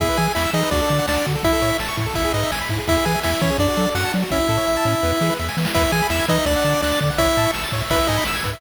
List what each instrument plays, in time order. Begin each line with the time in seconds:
0.00 synth bass 1 E2, lead 1 (square) E4 G#4 E5, kick, ride
0.09 lead 1 (square) B4
0.17 synth bass 1 E3, lead 1 (square) G#4 E5 G#5, ride
0.26 lead 1 (square) G#5
0.35 synth bass 1 E2, lead 1 (square) E4 E5 B5, snare
0.45 lead 1 (square) E6
0.53 synth bass 1 E3, lead 1 (square) D#4 G#4 D#5, ride
0.63 lead 1 (square) B4
0.71 synth bass 1 D2, lead 1 (square) D4 F#4 D5, kick, ride
0.81 lead 1 (square) A4
0.89 synth bass 1 D3, lead 1 (square) D5, ride
0.99 lead 1 (square) F#5
1.08 synth bass 1 D2, lead 1 (square) D4 D5 A5, snare
1.17 lead 1 (square) D6
1.25 synth bass 1 D3, lead 1 (square) F#4, kick, ride
1.35 lead 1 (square) A4
1.43 synth bass 1 A1, lead 1 (square) E4 E5, kick, ride
1.52 lead 1 (square) A4
1.61 synth bass 1 A2, lead 1 (square) C#5, ride
1.70 lead 1 (square) E5
1.79 synth bass 1 A1, lead 1 (square) A5, snare
1.88 lead 1 (square) C#6
1.97 synth bass 1 A2, lead 1 (square) E4, kick, ride
2.06 lead 1 (square) A4
2.14 synth bass 1 G#1, lead 1 (square) E4 E5, kick, ride
2.25 lead 1 (square) G#4
2.33 synth bass 1 G#2, lead 1 (square) D#4 B4 D#5, ride
2.43 lead 1 (square) E5
2.52 synth bass 1 G#1, lead 1 (square) G#5, snare
2.61 lead 1 (square) B5
2.69 synth bass 1 G#2, lead 1 (square) E4, kick, ride
2.78 lead 1 (square) G#4
2.87 synth bass 1 E2, lead 1 (square) E4 E5, kick, ride
2.96 lead 1 (square) G#4
3.05 synth bass 1 E3, lead 1 (square) G#4 B4 G#5, ride
3.14 lead 1 (square) E5
3.23 synth bass 1 E2, lead 1 (square) E4 E5 G#5, snare
3.32 lead 1 (square) B5
3.41 synth bass 1 E3, lead 1 (square) C#4 E4 C#5, kick, ride
3.50 lead 1 (square) G#4
3.58 synth bass 1 F#2, lead 1 (square) D4 D5, kick, ride
3.68 lead 1 (square) F#4
3.76 synth bass 1 F#3, lead 1 (square) A4, ride
3.86 lead 1 (square) D5
3.95 synth bass 1 F#2, lead 1 (square) F#4 F#5, snare
4.05 lead 1 (square) A5
4.12 synth bass 1 F#3, lead 1 (square) D4, ride
4.22 lead 1 (square) F#4
4.30 synth bass 1 A1, lead 1 (square) C#4 E4 E5, kick, snare
4.40 lead 1 (square) E4
4.49 synth bass 1 A2, lead 1 (square) A4, snare
4.57 lead 1 (square) C#5
4.67 synth bass 1 A1, lead 1 (square) E5, snare
4.77 lead 1 (square) A5
4.85 synth bass 1 A2, lead 1 (square) C#4, snare
4.93 lead 1 (square) E4
5.03 synth bass 1 E2, lead 1 (square) B3, snare
5.12 lead 1 (square) E4, snare
5.21 synth bass 1 E3, lead 1 (square) G#4, snare
5.30 lead 1 (square) B4, snare
5.39 synth bass 1 E2, lead 1 (square) E5, snare
5.49 lead 1 (square) G#5, snare
5.57 synth bass 1 E3, lead 1 (square) B3, snare
5.65 lead 1 (square) E4, snare
5.74 synth bass 1 E2, lead 1 (square) E4 B4 E5, kick, crash
5.84 lead 1 (square) E5
5.92 synth bass 1 E3, lead 1 (square) G#4 G#5, ride
6.02 lead 1 (square) B5
6.10 synth bass 1 E2, lead 1 (square) E4 E5 E6, snare
6.19 lead 1 (square) G#6
6.28 synth bass 1 E3, lead 1 (square) D#4 B4 D#5, kick, ride
6.38 lead 1 (square) E5
6.46 synth bass 1 D2, lead 1 (square) D4 D5, kick, ride
6.56 lead 1 (square) F#5
6.64 synth bass 1 D3, lead 1 (square) A5, ride
6.74 lead 1 (square) D6
6.82 synth bass 1 D2, lead 1 (square) D4 D5 F#6, snare
6.92 lead 1 (square) A6
7.00 synth bass 1 D3, lead 1 (square) D5, kick, ride
7.10 lead 1 (square) F#5
7.18 synth bass 1 A1, lead 1 (square) E4 C#5 E5, kick, ride
7.28 lead 1 (square) E5
7.37 synth bass 1 A2, lead 1 (square) A5, ride
7.46 lead 1 (square) C#6
7.54 synth bass 1 A1, lead 1 (square) E6, snare
7.64 lead 1 (square) A6
7.72 synth bass 1 A2, lead 1 (square) C#5, kick, ride
7.81 lead 1 (square) E5
7.90 synth bass 1 G#1, lead 1 (square) E4 B4 E5, kick, ride
7.99 lead 1 (square) E5
8.07 synth bass 1 G#2, lead 1 (square) D#4 D#5 G#5, ride
8.17 lead 1 (square) B5
8.25 synth bass 1 G#1, lead 1 (square) E6, snare
8.35 lead 1 (square) G#6
8.43 synth bass 1 G#2, lead 1 (square) B4, kick, ride
8.53 lead 1 (square) E5